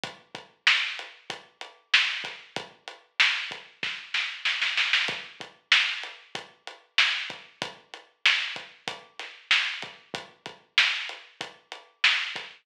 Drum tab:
HH |x-x---x-x-x---x-|x-x---x---------|x-x---x-x-x---x-|x-x---x-x-x---x-|
SD |----o-------o-o-|----o---o-o-oooo|----o-------o---|----o-----o-o---|
BD |o-o-----o-----o-|o-----o-o-------|o-o-----o-----o-|o-----o-o-----o-|

HH |x-x---x-x-x---x-|
SD |----o-------o-o-|
BD |o-o-----o-----o-|